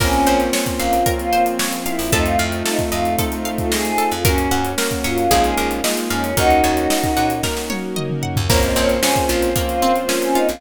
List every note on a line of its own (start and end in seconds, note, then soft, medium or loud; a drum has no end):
0.00 0.24 A#1 medium
0.00 0.96 A#3 loud
0.00 1.06 A#3 medium
0.00 0.96 C4 medium
0.00 1.06 C4 medium
0.00 2.01 C4 loud
0.00 0.96 C#4 loud
0.00 1.06 C#4 medium
0.00 0.40 C#4 loud
0.00 0.96 F4 loud
0.00 1.06 F4 loud
0.00 1.06 A#4 medium
0.00 kick loud
0.00 crash loud
0.13 closed hi-hat medium
0.27 0.51 A#1 medium
0.27 1.32 C5 medium
0.27 closed hi-hat medium
0.40 closed hi-hat medium
0.53 1.59 C#5 medium
0.53 snare loud
0.66 kick medium
0.66 closed hi-hat medium
0.80 1.04 A#1 medium
0.80 1.13 F4 medium
0.80 1.86 F5 medium
0.80 closed hi-hat medium
0.93 closed hi-hat medium
1.06 2.12 F3 medium
1.06 2.02 A#3 medium
1.06 2.12 A#3 medium
1.06 2.02 C4 medium
1.06 2.12 C4 medium
1.06 2.02 C#4 medium
1.06 2.02 F4 medium
1.06 2.12 F4 medium
1.06 2.07 A#4 medium
1.06 kick loud
1.06 closed hi-hat loud
1.18 1.43 F4 loud
1.18 closed hi-hat medium
1.33 2.08 C5 medium
1.33 closed hi-hat medium
1.46 closed hi-hat medium
1.59 2.10 C#5 medium
1.59 snare loud
1.73 closed hi-hat medium
1.86 2.11 E4 loud
1.86 2.11 F5 medium
1.86 closed hi-hat medium
1.99 2.11 A#1 medium
1.99 open hi-hat medium
2.12 2.37 F2 medium
2.12 3.08 A3 loud
2.12 3.18 A3 medium
2.12 3.92 A3 loud
2.12 3.08 C4 loud
2.12 3.18 C4 medium
2.12 2.24 D#4 loud
2.12 3.08 D#4 loud
2.12 3.18 D#4 medium
2.12 3.08 F4 loud
2.12 3.18 F4 medium
2.12 2.65 A4 loud
2.12 kick loud
2.12 closed hi-hat loud
2.24 2.37 F4 medium
2.24 closed hi-hat medium
2.39 2.63 F2 medium
2.39 3.45 F5 medium
2.39 closed hi-hat medium
2.52 closed hi-hat medium
2.65 2.79 D#4 medium
2.65 3.18 A4 medium
2.65 snare loud
2.79 kick medium
2.79 closed hi-hat medium
2.92 3.16 F2 medium
2.92 3.14 F4 loud
2.92 3.71 D#5 medium
2.92 closed hi-hat medium
3.05 closed hi-hat medium
3.18 4.23 A3 medium
3.18 4.14 A3 medium
3.18 4.23 C4 medium
3.18 4.14 C4 medium
3.18 4.14 D#4 loud
3.18 4.23 F4 medium
3.18 4.14 F4 medium
3.18 4.23 A4 medium
3.18 3.98 A4 medium
3.18 kick medium
3.18 closed hi-hat loud
3.32 closed hi-hat medium
3.45 4.21 F5 medium
3.45 closed hi-hat medium
3.58 3.71 F4 medium
3.58 kick medium
3.58 closed hi-hat medium
3.71 3.84 G#4 medium
3.71 4.22 D#5 medium
3.71 snare loud
3.85 4.09 G#4 medium
3.85 closed hi-hat medium
3.98 4.23 A4 medium
3.98 closed hi-hat medium
4.12 4.24 F2 medium
4.12 4.25 F4 loud
4.12 closed hi-hat medium
4.25 4.49 F#2 medium
4.25 4.72 A#3 loud
4.25 4.77 A#3 medium
4.25 4.62 C#4 loud
4.25 4.72 C#4 loud
4.25 4.77 C#4 medium
4.25 5.82 C#4 medium
4.25 4.72 F#4 loud
4.25 4.77 F#4 medium
4.25 4.78 A#4 medium
4.25 kick loud
4.25 closed hi-hat loud
4.38 closed hi-hat medium
4.51 4.75 F#2 medium
4.51 5.27 F#5 medium
4.51 closed hi-hat medium
4.65 closed hi-hat medium
4.78 5.31 F#3 medium
4.78 5.25 A#3 medium
4.78 5.30 A#3 medium
4.78 5.25 C#4 medium
4.78 5.25 F#4 medium
4.78 5.31 F#4 medium
4.78 5.29 A#4 medium
4.78 snare loud
4.91 kick medium
4.91 closed hi-hat medium
5.04 5.28 F#2 medium
5.04 5.42 F4 loud
5.04 5.30 C#5 medium
5.04 closed hi-hat medium
5.18 closed hi-hat medium
5.31 5.55 A#1 medium
5.31 5.83 G#3 medium
5.31 5.80 G#3 loud
5.31 5.83 A#3 medium
5.31 5.80 A#3 loud
5.31 5.83 D#4 medium
5.31 5.80 D#4 medium
5.31 5.83 F4 medium
5.31 5.80 F4 loud
5.31 6.32 G#4 medium
5.31 kick medium
5.31 closed hi-hat loud
5.44 5.68 G#4 medium
5.44 closed hi-hat medium
5.58 5.81 A#1 medium
5.58 6.33 A#4 medium
5.58 closed hi-hat medium
5.71 closed hi-hat medium
5.84 6.32 G#3 medium
5.84 6.37 G#3 medium
5.84 6.32 A#3 loud
5.84 6.37 A#3 medium
5.84 6.32 D#4 medium
5.84 6.30 D#4 medium
5.84 6.32 F4 loud
5.84 6.37 F4 medium
5.84 6.37 G#4 medium
5.84 6.35 D#5 medium
5.84 snare loud
5.97 closed hi-hat medium
6.10 6.34 F2 medium
6.10 6.35 C#4 medium
6.10 6.36 F5 medium
6.10 closed hi-hat medium
6.24 closed hi-hat medium
6.37 6.61 D#2 medium
6.37 7.33 A#3 loud
6.37 7.42 A#3 medium
6.37 7.33 C#4 medium
6.37 7.42 C#4 medium
6.37 7.33 D#4 medium
6.37 7.26 D#4 loud
6.37 7.43 D#4 medium
6.37 6.84 F#4 loud
6.37 7.33 F#4 loud
6.37 7.26 F#4 loud
6.37 7.42 F#4 medium
6.37 7.43 A#4 medium
6.37 kick loud
6.37 closed hi-hat loud
6.50 closed hi-hat medium
6.64 6.88 D#2 medium
6.64 7.69 C#5 medium
6.64 closed hi-hat medium
6.77 closed hi-hat medium
6.90 7.96 D#5 medium
6.90 snare loud
7.04 kick medium
7.04 closed hi-hat medium
7.17 7.41 A#2 medium
7.17 8.22 F#5 medium
7.17 closed hi-hat medium
7.30 closed hi-hat medium
7.43 8.48 A#3 medium
7.43 8.39 A#3 medium
7.43 8.48 C#4 medium
7.43 8.39 C#4 medium
7.43 8.39 D#4 medium
7.43 8.48 F#4 medium
7.43 8.39 F#4 medium
7.43 8.48 A#4 medium
7.43 8.45 A#4 medium
7.43 kick medium
7.43 snare medium
7.57 snare medium
7.70 8.45 C#5 medium
7.70 high tom medium
7.96 8.47 D#5 medium
7.96 mid tom medium
8.10 mid tom medium
8.23 8.48 F#5 medium
8.23 floor tom medium
8.36 8.49 D#2 medium
8.36 floor tom loud
8.48 8.74 A#1 medium
8.48 9.54 A#3 medium
8.48 8.97 A#3 loud
8.48 9.55 A#3 medium
8.48 9.54 C4 medium
8.48 8.97 C4 loud
8.48 9.54 C#4 medium
8.48 8.97 C#4 loud
8.48 9.54 F4 medium
8.48 8.97 F4 loud
8.48 10.42 C5 loud
8.48 8.62 C#5 loud
8.48 kick loud
8.48 crash loud
8.63 8.75 D#5 loud
8.63 closed hi-hat medium
8.76 9.00 A#1 medium
8.76 9.82 C4 medium
8.76 8.89 C#5 medium
8.76 closed hi-hat medium
8.89 closed hi-hat medium
9.02 9.50 A#3 medium
9.02 9.50 C4 medium
9.02 9.50 C#4 loud
9.02 10.08 C#4 medium
9.02 9.50 F4 loud
9.02 9.25 G#4 medium
9.02 snare loud
9.16 kick medium
9.16 closed hi-hat medium
9.29 9.54 A#1 medium
9.29 9.50 F4 loud
9.29 10.35 F4 medium
9.29 closed hi-hat medium
9.42 closed hi-hat medium
9.56 10.61 F3 medium
9.56 10.56 A#3 medium
9.56 10.04 A#3 medium
9.56 10.61 A#3 medium
9.56 10.04 C4 medium
9.56 10.61 C4 medium
9.56 10.04 C#4 medium
9.56 10.04 F4 loud
9.56 10.61 F4 medium
9.56 kick loud
9.56 closed hi-hat loud
9.68 9.92 F4 loud
9.68 closed hi-hat medium
9.82 10.58 C4 medium
9.82 closed hi-hat medium
9.96 closed hi-hat medium
10.08 10.56 A#3 medium
10.08 10.56 C4 medium
10.08 10.56 C#4 medium
10.08 10.59 C#4 medium
10.08 10.56 F4 medium
10.08 snare loud
10.22 10.36 C#4 medium
10.22 closed hi-hat medium
10.35 10.47 D#4 medium
10.35 10.61 F4 medium
10.35 closed hi-hat medium
10.49 10.61 A#1 medium
10.49 10.61 F4 medium
10.49 closed hi-hat medium